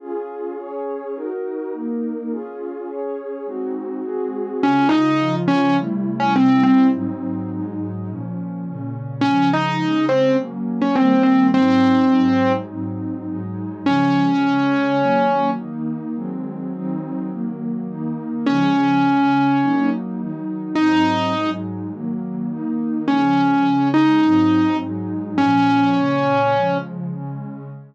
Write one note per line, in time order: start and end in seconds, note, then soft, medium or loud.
0.00 0.57 C#4 medium
0.00 0.57 F4 medium
0.00 0.57 G#4 medium
0.58 1.15 C#4 medium
0.58 1.15 G#4 medium
0.58 1.15 C#5 medium
1.15 1.72 D#4 medium
1.15 1.72 F#4 medium
1.15 1.72 A#4 medium
1.73 2.30 A#3 medium
1.73 2.30 D#4 medium
1.73 2.30 A#4 medium
2.31 2.88 C#4 medium
2.31 2.88 F4 medium
2.31 2.88 G#4 medium
2.88 3.46 C#4 medium
2.88 3.46 G#4 medium
2.88 3.46 C#5 medium
3.46 4.03 G#3 medium
3.46 4.03 C4 medium
3.46 4.03 D#4 medium
3.46 4.03 F#4 medium
4.04 4.61 G#3 medium
4.04 4.61 C4 medium
4.04 4.61 F#4 medium
4.04 4.61 G#4 medium
4.62 5.19 C#3 medium
4.62 5.19 G#3 medium
4.62 4.87 C#4 loud
4.62 5.19 F4 medium
4.89 5.35 D#4 medium
5.19 5.76 C#3 medium
5.19 5.76 F3 medium
5.19 5.76 F4 medium
5.48 5.76 C#4 loud
5.77 6.34 C3 medium
5.77 6.34 G3 medium
5.77 6.34 A3 medium
5.77 6.34 E4 medium
6.20 6.34 C#4 medium
6.35 6.92 C3 medium
6.35 6.92 G3 medium
6.35 6.92 C4 medium
6.35 6.63 C4 loud
6.35 6.92 E4 medium
6.63 6.87 C4 medium
6.92 7.49 G#2 medium
6.92 7.49 F#3 medium
6.92 7.49 C4 medium
6.92 7.49 D#4 medium
7.50 8.07 G#2 medium
7.50 8.07 F#3 medium
7.50 8.07 G#3 medium
7.50 8.07 D#4 medium
8.08 8.65 A#2 medium
8.08 8.65 F3 medium
8.08 8.65 C#4 medium
8.65 9.22 A#2 medium
8.65 9.22 C#3 medium
8.65 9.22 C#4 medium
9.21 9.80 C#3 medium
9.21 9.80 F3 medium
9.21 9.80 G#3 medium
9.21 9.49 C#4 loud
9.53 10.05 D#4 medium
9.81 10.38 C#3 medium
9.81 10.38 G#3 medium
9.81 10.38 C#4 medium
10.09 10.36 C4 medium
10.38 10.95 F#3 medium
10.38 10.95 A#3 medium
10.38 10.95 C#4 medium
10.82 10.95 C#4 medium
10.96 11.53 D#3 medium
10.96 11.53 G3 medium
10.96 11.53 A#3 medium
10.96 11.22 C4 medium
11.23 11.47 C4 medium
11.54 12.11 G#2 medium
11.54 12.11 F#3 medium
11.54 12.11 C4 medium
11.54 12.52 C4 loud
11.54 12.11 D#4 medium
12.11 12.69 G#2 medium
12.11 12.69 F#3 medium
12.11 12.69 G#3 medium
12.11 12.69 D#4 medium
12.69 13.26 G#2 medium
12.69 13.26 F#3 medium
12.69 13.26 C4 medium
12.69 13.26 D#4 medium
13.27 13.84 G#2 medium
13.27 13.84 F#3 medium
13.27 13.84 G#3 medium
13.27 13.84 D#4 medium
13.85 14.42 C#3 medium
13.85 14.42 F3 medium
13.85 14.42 G#3 medium
13.85 15.50 C#4 loud
14.42 14.99 C#3 medium
14.42 14.99 G#3 medium
14.42 14.99 C#4 medium
15.00 15.57 D#3 medium
15.00 15.57 F#3 medium
15.00 15.57 A#3 medium
15.58 16.15 D#3 medium
15.58 16.15 A#3 medium
15.58 16.15 D#4 medium
16.15 16.72 D#3 medium
16.15 16.72 F#3 medium
16.15 16.72 G#3 medium
16.15 16.72 C4 medium
16.73 17.30 D#3 medium
16.73 17.30 F#3 medium
16.73 17.30 C4 medium
16.73 17.30 D#4 medium
17.31 17.88 D#3 medium
17.31 17.88 F#3 medium
17.31 17.88 A#3 medium
17.88 18.46 D#3 medium
17.88 18.46 A#3 medium
17.88 18.46 D#4 medium
18.46 19.03 C#3 medium
18.46 19.03 F3 medium
18.46 19.03 G#3 medium
18.46 19.90 C#4 loud
19.04 19.61 C#3 medium
19.04 19.61 G#3 medium
19.04 19.61 C#4 medium
19.62 20.19 F#3 medium
19.62 20.19 A#3 medium
19.62 20.19 D#4 medium
20.19 20.76 D#3 medium
20.19 20.76 F#3 medium
20.19 20.76 D#4 medium
20.75 21.34 G#2 medium
20.75 21.34 F#3 medium
20.75 21.34 C4 medium
20.75 21.50 D#4 loud
20.75 21.34 D#4 medium
21.35 21.92 G#2 medium
21.35 21.92 F#3 medium
21.35 21.92 G#3 medium
21.35 21.92 D#4 medium
21.92 22.49 D#3 medium
21.92 22.49 F#3 medium
21.92 22.49 A#3 medium
22.50 23.07 D#3 medium
22.50 23.07 A#3 medium
22.50 23.07 D#4 medium
23.08 23.65 C#3 medium
23.08 23.65 F3 medium
23.08 23.65 G#3 medium
23.08 23.88 C#4 loud
23.65 24.22 C#3 medium
23.65 24.22 G#3 medium
23.65 24.22 C#4 medium
23.94 24.77 D#4 loud
24.23 24.80 G#2 medium
24.23 24.80 F#3 medium
24.23 24.80 C4 medium
24.23 24.80 D#4 medium
24.81 25.38 G#2 medium
24.81 25.38 F#3 medium
24.81 25.38 G#3 medium
24.81 25.38 D#4 medium
25.38 25.95 A#2 medium
25.38 25.95 F3 medium
25.38 26.78 C#4 loud
25.38 25.95 C#4 medium
25.96 26.53 A#2 medium
25.96 26.53 C#3 medium
25.96 26.53 C#4 medium
26.54 27.11 C#3 medium
26.54 27.11 F3 medium
26.54 27.11 G#3 medium
27.12 27.69 C#3 medium
27.12 27.69 G#3 medium
27.12 27.69 C#4 medium